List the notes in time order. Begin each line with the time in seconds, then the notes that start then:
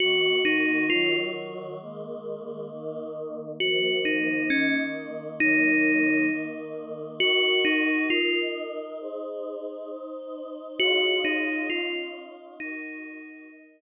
0.00 D#3 A#3 F#4
0.45 D#4
0.90 D#3 F#3 F4 F#4
1.80 D#3 G#3 A#3
2.70 D#3 A#3 D#4
3.60 D#3 F3 A#3 F#4
4.05 D#4
4.50 D#3 A#3 C#4 D#4
5.40 D#3 F#3 A#3 D#4
6.30 D#3 A#3 D#4
7.20 D#4 F#4 A#4
7.65 D#4
8.10 D#4 F4 A#4 D#5
9.00 D#4 G#4 C5
9.89 D#4 C5 D#5
10.79 D#4 F4 F#4 G#4 C#5
11.25 D#4
11.70 C#4 D#4 F4 C#5
12.60 D#4 F#4 A#4
13.50 D#4 A#4 D#5